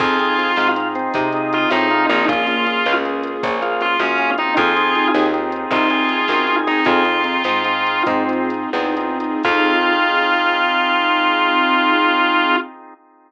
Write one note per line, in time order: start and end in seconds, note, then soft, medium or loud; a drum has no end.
0.00 0.51 F2 loud
0.00 0.18 C4 loud
0.00 2.26 C4 medium
0.00 0.18 D#4 loud
0.00 2.26 D#4 medium
0.00 0.18 F4 loud
0.00 0.68 F4 medium
0.00 2.26 F4 medium
0.00 0.18 G#4 loud
0.00 0.51 G#4 medium
0.00 2.26 G#4 medium
0.00 kick loud
0.00 crash loud
0.19 0.37 C4 loud
0.19 0.37 D#4 loud
0.19 0.37 F4 loud
0.19 0.37 G#4 medium
0.19 closed hi-hat medium
0.38 0.56 C4 medium
0.38 0.56 D#4 medium
0.38 0.56 F4 loud
0.38 0.56 G#4 loud
0.38 closed hi-hat medium
0.56 1.09 G#2 medium
0.56 0.75 C4 loud
0.56 0.75 D#4 medium
0.56 0.75 F4 medium
0.56 0.88 F4 medium
0.56 0.75 G#4 medium
0.56 snare loud
0.76 1.29 C4 medium
0.76 1.29 D#4 loud
0.76 1.29 F4 loud
0.76 1.29 G#4 medium
0.76 closed hi-hat loud
0.95 1.13 C4 medium
0.95 closed hi-hat medium
1.14 1.66 C3 medium
1.14 1.69 D#4 medium
1.14 kick loud
1.14 closed hi-hat loud
1.33 1.68 C4 loud
1.33 1.68 D#4 medium
1.33 1.68 F4 loud
1.33 1.68 G#4 loud
1.33 closed hi-hat medium
1.53 1.69 F4 medium
1.53 closed hi-hat loud
1.70 2.07 A2 medium
1.70 1.89 C4 loud
1.70 1.89 C4 medium
1.70 1.89 D#4 loud
1.70 2.06 D#4 medium
1.70 1.89 F4 medium
1.70 1.89 G#4 medium
1.70 snare loud
1.90 2.08 C4 medium
1.90 2.08 D#4 medium
1.90 2.08 F4 loud
1.90 2.23 F4 medium
1.90 2.08 G#4 medium
1.90 closed hi-hat medium
2.09 2.80 A#1 loud
2.09 2.27 C4 medium
2.09 2.25 D#4 medium
2.09 2.27 D#4 medium
2.09 2.27 F4 medium
2.09 2.27 G#4 loud
2.09 closed hi-hat medium
2.28 2.46 A#3 loud
2.28 4.56 A#3 medium
2.28 2.46 C#4 loud
2.28 4.56 C#4 loud
2.28 2.93 F4 medium
2.28 2.46 F4 loud
2.28 2.96 F4 medium
2.28 4.56 F4 medium
2.28 2.46 G#4 loud
2.28 4.56 G#4 medium
2.28 kick loud
2.28 closed hi-hat loud
2.47 2.65 A#3 medium
2.47 2.65 C#4 medium
2.47 2.65 F4 medium
2.47 2.65 G#4 medium
2.47 closed hi-hat medium
2.66 2.84 A#3 loud
2.66 2.84 C#4 loud
2.66 2.84 F4 medium
2.66 2.84 G#4 loud
2.66 closed hi-hat medium
2.86 3.38 C#2 medium
2.86 3.03 A#3 loud
2.86 3.03 C#4 loud
2.86 3.03 F4 medium
2.86 3.03 G#4 medium
2.86 snare loud
3.05 3.57 A#3 loud
3.05 3.57 C#4 medium
3.05 3.57 F4 medium
3.05 3.57 G#4 medium
3.05 closed hi-hat medium
3.23 closed hi-hat loud
3.43 3.95 A#1 medium
3.43 3.61 C#4 medium
3.43 kick loud
3.43 closed hi-hat loud
3.62 3.97 A#3 loud
3.62 3.97 C#4 medium
3.62 3.97 F4 loud
3.62 4.38 F4 medium
3.62 3.97 G#4 loud
3.62 closed hi-hat medium
3.81 4.00 F4 medium
3.81 closed hi-hat medium
3.99 4.51 F#2 medium
3.99 4.18 A#3 loud
3.99 4.30 C#4 medium
3.99 4.18 C#4 medium
3.99 4.18 F4 loud
3.99 4.18 G#4 loud
3.99 snare loud
4.18 4.37 A#3 loud
4.18 4.37 C#4 loud
4.18 4.37 F4 loud
4.18 4.37 G#4 loud
4.18 closed hi-hat medium
4.38 4.75 C4 loud
4.38 4.75 D#4 loud
4.38 4.54 D#4 medium
4.38 4.75 F4 loud
4.38 4.75 G#4 loud
4.38 closed hi-hat medium
4.57 5.09 F2 loud
4.57 6.85 C4 medium
4.57 6.85 D#4 medium
4.57 5.07 F4 medium
4.57 6.85 F4 loud
4.57 5.27 G#4 medium
4.57 6.85 G#4 medium
4.57 kick loud
4.57 closed hi-hat loud
4.76 4.94 C4 loud
4.76 4.94 D#4 loud
4.76 4.94 F4 loud
4.76 4.94 G#4 loud
4.76 closed hi-hat medium
4.95 5.13 C4 medium
4.95 5.13 D#4 medium
4.95 5.13 F4 loud
4.95 5.13 G#4 medium
4.95 closed hi-hat medium
5.14 5.66 D#2 medium
5.14 5.32 C4 medium
5.14 5.32 D#4 loud
5.14 5.32 F4 loud
5.14 5.32 G#4 medium
5.14 snare loud
5.33 5.86 C4 loud
5.33 5.86 D#4 medium
5.33 5.86 F4 medium
5.33 5.86 G#4 loud
5.33 closed hi-hat medium
5.52 closed hi-hat medium
5.71 6.22 C2 medium
5.71 5.89 D#4 medium
5.71 6.56 F4 medium
5.71 kick loud
5.71 closed hi-hat loud
5.90 6.26 C4 medium
5.90 6.26 D#4 loud
5.90 6.26 F4 medium
5.90 6.26 G#4 medium
5.90 6.81 G#4 medium
5.90 closed hi-hat medium
6.09 closed hi-hat medium
6.28 6.80 F#2 medium
6.28 6.46 C4 loud
6.28 6.46 D#4 loud
6.28 6.46 F4 medium
6.28 6.46 G#4 medium
6.28 snare loud
6.47 6.65 C4 medium
6.47 6.65 D#4 medium
6.47 6.65 F4 loud
6.47 6.65 G#4 medium
6.47 closed hi-hat medium
6.67 6.84 C4 medium
6.67 6.84 D#4 loud
6.67 6.86 D#4 medium
6.67 6.84 F4 loud
6.67 6.84 G#4 loud
6.67 closed hi-hat medium
6.85 7.39 F2 medium
6.85 9.42 C4 medium
6.85 7.03 C4 loud
6.85 9.42 D#4 medium
6.85 7.03 D#4 loud
6.85 8.03 F4 medium
6.85 9.42 F4 medium
6.85 7.03 F4 loud
6.85 9.42 G#4 medium
6.85 7.03 G#4 medium
6.85 7.03 G#4 loud
6.85 kick loud
6.85 closed hi-hat loud
7.05 7.23 C4 loud
7.05 7.23 D#4 loud
7.05 7.23 F4 loud
7.05 7.23 G#4 medium
7.05 closed hi-hat medium
7.24 7.43 C4 loud
7.24 7.43 D#4 loud
7.24 7.43 F4 medium
7.24 7.43 G#4 medium
7.24 closed hi-hat medium
7.44 8.01 G#2 medium
7.44 7.63 C4 loud
7.44 7.63 D#4 medium
7.44 7.63 F4 loud
7.44 7.63 G#4 loud
7.44 snare loud
7.64 8.23 C4 loud
7.64 8.23 D#4 loud
7.64 8.23 F4 loud
7.64 8.23 G#4 loud
7.64 closed hi-hat medium
7.87 closed hi-hat medium
8.06 8.66 G#2 medium
8.06 8.49 C4 medium
8.06 kick loud
8.06 closed hi-hat loud
8.29 8.70 C4 loud
8.29 8.70 D#4 medium
8.29 8.70 F4 loud
8.29 8.70 G#4 loud
8.29 closed hi-hat medium
8.50 closed hi-hat medium
8.73 9.37 E2 medium
8.73 8.95 C4 loud
8.73 8.95 D#4 medium
8.73 8.95 F4 loud
8.73 8.95 G#4 medium
8.73 snare loud
8.97 9.18 C4 loud
8.97 9.18 D#4 loud
8.97 9.18 F4 loud
8.97 9.18 G#4 loud
8.97 closed hi-hat loud
9.20 9.43 C4 medium
9.20 9.43 D#4 loud
9.20 9.43 F4 medium
9.20 9.43 G#4 loud
9.20 closed hi-hat loud
9.43 12.56 F2 loud
9.43 12.54 C4 loud
9.43 12.56 C4 medium
9.43 12.54 D#4 loud
9.43 12.56 D#4 loud
9.43 12.54 F4 loud
9.43 12.56 F4 loud
9.43 12.54 G#4 medium
9.43 12.56 G#4 medium
9.43 kick loud
9.43 crash loud